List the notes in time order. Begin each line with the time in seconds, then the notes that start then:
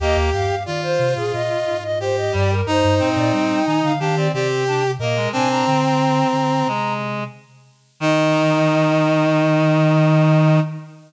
0.00 D#2 A#3 G4 D#5
0.16 D#2
0.33 G2 F5
0.49 G2
0.65 D#3 F4 D5
0.83 C5
0.99 C3
1.16 A#2 G#4
1.33 A#2 D#5
1.66 G#2
1.83 D#5
2.00 G4 C5
2.16 D#5
2.32 G2 G3 D5
2.51 A#4
2.66 G2 D#4 C5
2.84 G2
2.99 A#2 C4
3.16 A#2 D5
3.33 G3 G5
3.65 D#3 D#4 G#5
3.82 D3 F5
4.00 D#3 D4 G4 F5
4.16 C4 D5
4.32 C3 C4 G4 D5
4.67 D4
4.99 A#2 A#3 A#4 D#5
5.16 G#3
5.32 C3 C4 D4 G#5
5.49 D4 A#5
5.66 D3 C4
5.84 A#5
6.33 D3
6.67 C3 G#3
8.00 D#3 D#4 D#5